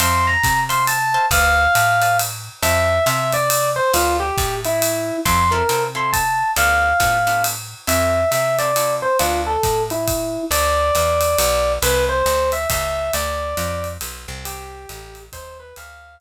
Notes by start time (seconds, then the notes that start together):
0.00 F2 C5 E5 F5 A5 C6, ride
0.27 A#5
0.43 C3, kick, hi-hat pedal, ride
0.69 C5 E5 F5 A5 C6, ride
0.87 A5, ride
1.14 C5 E5 F5 A5
1.31 D2 B4 D5 F5 A5, kick, ride
1.75 A2, hi-hat pedal, ride
2.02 B4 D5 F5 A5, ride
2.19 ride
2.62 F2 C5 E5 F5 A5, ride
3.06 C3 C5 E5 F5 A5, hi-hat pedal, ride
3.32 D5, ride
3.50 ride
3.76 C5
3.94 D2 F4 B4 D5 F5 A5, ride
4.20 G4
4.37 A2, kick, hi-hat pedal, ride
4.65 E4, ride
4.82 ride
5.25 F2 C4 E4 F4 A4 C6, kick, ride
5.51 C4 E4 F4 A4 A#4
5.69 C3 C4 E4 F4 A4, hi-hat pedal, ride
5.95 C4 E4 F4 A4 C6
6.13 A5, kick, ride
6.56 D2 B3 D4 F4 A4 F5, ride
7.00 A2 B3 D4 F4 A4, kick, hi-hat pedal, ride
7.27 B3 D4 F4 A4, ride
7.44 ride
7.87 F2 C4 E4 F4 A4 E5, ride
8.31 C3 E5, hi-hat pedal, ride
8.59 C4 E4 F4 A4 D5, ride
8.76 C4 E4 F4 A4, ride
9.02 C5
9.19 D2 B3 D4 F4 A4, ride
9.47 A4
9.63 A2, kick, hi-hat pedal, ride
9.90 E4, ride
10.08 kick, ride
10.51 D2 D5, ride
10.95 E2, hi-hat pedal, ride
11.21 ride
11.39 B1, ride
11.82 C2 B4, ride
12.09 C5
12.26 D2, hi-hat pedal, ride
12.52 E5, ride
12.70 C#2 E5, kick, ride
13.13 D2 D5, ride
13.57 F2, hi-hat pedal, ride
13.84 ride
14.01 B1, ride
14.28 C2
14.45 G4, ride
14.89 A1, hi-hat pedal, ride
15.15 ride
15.32 D#2 C5, kick, ride
15.60 B4
15.76 D2 F5, ride
16.20 hi-hat pedal